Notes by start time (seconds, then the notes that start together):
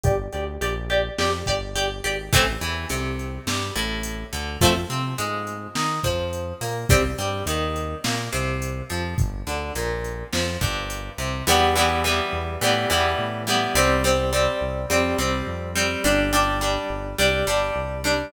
0.03 G1 G4 D5, kick, closed hi-hat
0.33 D2 G4 D5, closed hi-hat
0.61 A#1 G4 D5, closed hi-hat
0.90 G4 D5, closed hi-hat
1.18 F2 G4 D5, snare
1.46 G1 G4 D5, kick, closed hi-hat
1.75 G1 G4 D5, closed hi-hat
2.04 G#1 G4 D5, closed hi-hat
2.33 A1 E3 A3 C4, kick, closed hi-hat
2.61 E2 E3, closed hi-hat
2.89 C2 C3, closed hi-hat
3.19 closed hi-hat
3.46 G2 G3, snare
3.75 A1 A2, closed hi-hat
4.03 closed hi-hat
4.33 D2 D3, closed hi-hat
4.60 F2 F3 A3 C4, kick, closed hi-hat
4.90 C3 C4, closed hi-hat
5.18 G#2 G#3, closed hi-hat
5.47 closed hi-hat
5.75 D#3 D#4, snare
6.03 F2 F3, kick, closed hi-hat
6.33 closed hi-hat
6.61 A#2 A#3, open hi-hat
6.89 C2 G3 C4, kick, closed hi-hat
7.18 G2 G3, closed hi-hat
7.46 D#2 D#3, closed hi-hat
7.76 closed hi-hat
8.04 A#2 A#3, snare
8.32 C2 C3, closed hi-hat
8.62 closed hi-hat
8.90 F2 F3, closed hi-hat
9.18 G1, kick, closed hi-hat
9.47 D2 D3, closed hi-hat
9.75 A#1 A#2, closed hi-hat
10.04 closed hi-hat
10.33 F2 F3, snare
10.61 G1 G2, kick, closed hi-hat
10.90 closed hi-hat
11.18 C2 C3, closed hi-hat
11.47 E2 E3 G3 B3
11.75 E3 G3 B3
12.04 E3 G3 B3
12.33 E2
12.61 A2 E3 G3 B3
12.90 E2 E3 G3 B3
13.18 A2
13.47 E3 G3 B3
13.75 C2 G3 C4
14.04 G3 C4
14.33 G3 C4
14.61 C2
14.90 F2 G3 C4
15.18 C2 G3 C4
15.47 F2
15.75 G3 C4
16.04 G1 G3 D4
16.33 G3 D4
16.61 G3 D4
16.90 G1
17.18 C2 G3 D4
17.47 G1 G3 D4
17.76 C2
18.04 G3 D4